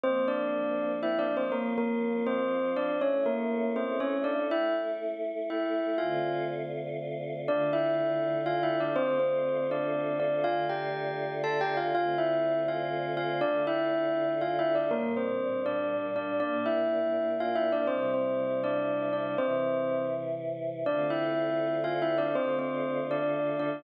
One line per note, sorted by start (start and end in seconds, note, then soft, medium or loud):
0.03 1.51 F3 medium
0.03 1.51 A#3 medium
0.03 0.26 C4 medium
0.03 1.51 C4 medium
0.03 0.26 C5 medium
0.28 0.91 D4 medium
0.28 0.91 D5 medium
1.03 1.18 E4 medium
1.03 1.18 E5 medium
1.19 1.34 D4 medium
1.19 1.34 D5 medium
1.37 1.52 C4 medium
1.37 1.52 C5 medium
1.52 3.00 F3 medium
1.52 1.73 A#3 medium
1.52 3.00 C4 medium
1.52 3.00 F4 medium
1.52 1.73 A#4 medium
1.78 2.24 A#3 medium
1.78 2.24 A#4 medium
2.26 2.70 C4 medium
2.26 2.70 C5 medium
2.76 2.96 D4 medium
2.76 2.96 D5 medium
3.01 4.48 A3 medium
3.01 4.48 C#4 medium
3.01 3.23 C#4 medium
3.01 4.48 E4 medium
3.01 3.23 C#5 medium
3.26 3.69 A#3 medium
3.26 3.69 A#4 medium
3.76 3.99 C4 medium
3.76 3.99 C5 medium
4.00 4.22 C#4 medium
4.00 4.22 C#5 medium
4.24 4.44 D4 medium
4.24 4.44 D5 medium
4.50 5.97 A3 medium
4.50 5.97 E4 medium
4.50 4.74 E4 medium
4.50 5.97 A4 medium
4.50 4.74 E5 medium
5.50 5.97 E4 soft
5.50 5.97 E5 medium
5.98 7.46 D3 medium
5.98 7.46 A3 medium
5.98 7.46 C4 medium
5.98 6.41 F4 medium
5.98 7.46 F4 medium
5.98 6.41 F5 medium
7.47 8.94 D3 loud
7.47 8.94 A3 medium
7.47 8.94 D4 medium
7.47 7.69 D4 medium
7.47 8.94 F4 medium
7.47 7.69 D5 medium
7.73 8.37 E4 medium
7.73 8.37 E5 medium
8.46 8.62 F4 medium
8.46 8.62 F5 medium
8.63 8.79 E4 medium
8.63 8.79 E5 medium
8.80 8.96 D4 medium
8.80 8.96 D5 medium
8.96 10.44 D3 medium
8.96 10.44 A3 medium
8.96 9.18 C4 medium
8.96 10.44 C4 medium
8.96 10.44 F4 medium
8.96 9.18 C5 medium
9.20 9.64 C4 medium
9.20 9.64 C5 medium
9.71 10.16 D4 medium
9.71 10.16 D5 medium
10.20 10.44 D4 medium
10.20 10.44 D5 medium
10.44 11.92 D3 medium
10.44 11.92 A3 medium
10.44 11.92 D4 medium
10.44 10.64 F4 medium
10.44 11.92 F4 medium
10.44 10.64 F5 medium
10.69 11.33 G4 medium
10.69 11.33 G5 medium
11.44 11.59 A4 medium
11.44 11.59 A5 medium
11.61 11.77 G4 medium
11.61 11.77 G5 medium
11.77 11.93 F4 medium
11.77 11.93 F5 medium
11.93 13.40 D3 medium
11.93 13.40 A3 medium
11.93 13.40 C4 medium
11.93 13.40 F4 medium
11.93 12.16 F4 medium
11.93 12.16 F5 medium
12.18 12.60 E4 medium
12.18 12.60 E5 medium
12.68 13.11 F4 medium
12.68 13.11 F5 medium
13.17 13.40 F4 medium
13.17 13.40 F5 medium
13.41 14.89 D3 medium
13.41 14.89 A3 medium
13.41 13.63 D4 medium
13.41 14.89 D4 medium
13.41 14.89 F4 medium
13.41 13.63 D5 medium
13.67 14.32 E4 medium
13.67 14.32 E5 medium
14.41 14.57 F4 medium
14.41 14.57 F5 medium
14.59 14.75 E4 medium
14.59 14.75 E5 medium
14.75 14.91 D4 medium
14.75 14.91 D5 medium
14.91 16.38 A#2 medium
14.91 16.38 G3 medium
14.91 15.12 A#3 medium
14.91 16.38 D4 medium
14.91 15.12 A#4 medium
15.17 15.59 C4 medium
15.17 15.59 C5 medium
15.66 16.07 D4 medium
15.66 16.07 D5 medium
16.16 16.39 D4 medium
16.16 16.39 D5 medium
16.39 17.86 A#2 medium
16.39 17.86 A#3 medium
16.39 17.86 D4 medium
16.39 16.63 D4 medium
16.39 16.63 D5 medium
16.66 17.30 E4 medium
16.66 17.30 E5 medium
17.40 17.56 F4 medium
17.40 17.56 F5 medium
17.55 17.71 E4 medium
17.55 17.71 E5 medium
17.72 17.88 D4 medium
17.72 17.88 D5 medium
17.87 19.36 C3 medium
17.87 19.36 G3 medium
17.87 18.11 C4 medium
17.87 19.36 E4 medium
17.87 18.11 C5 medium
18.14 18.60 C4 medium
18.14 18.60 C5 medium
18.64 19.11 D4 medium
18.64 19.11 D5 medium
19.13 19.34 D4 medium
19.13 19.34 D5 medium
19.37 20.84 C3 medium
19.37 20.84 E3 medium
19.37 20.02 C4 medium
19.37 20.84 E4 medium
19.37 20.02 C5 medium
20.86 22.33 D3 medium
20.86 22.33 A3 medium
20.86 22.33 C4 medium
20.86 21.07 D4 medium
20.86 22.33 F4 medium
20.86 21.07 D5 medium
21.10 21.76 E4 medium
21.10 21.76 E5 medium
21.84 22.00 F4 medium
21.84 22.00 F5 medium
22.02 22.18 E4 medium
22.02 22.18 E5 medium
22.18 22.34 D4 medium
22.18 22.34 D5 medium
22.35 23.82 D3 medium
22.35 23.82 A3 medium
22.35 22.56 C4 medium
22.35 23.82 D4 medium
22.35 23.82 F4 medium
22.35 22.56 C5 medium
22.59 22.99 C4 medium
22.59 22.99 C5 medium
23.11 23.55 D4 medium
23.11 23.55 D5 medium
23.59 23.82 D4 medium
23.59 23.82 D5 medium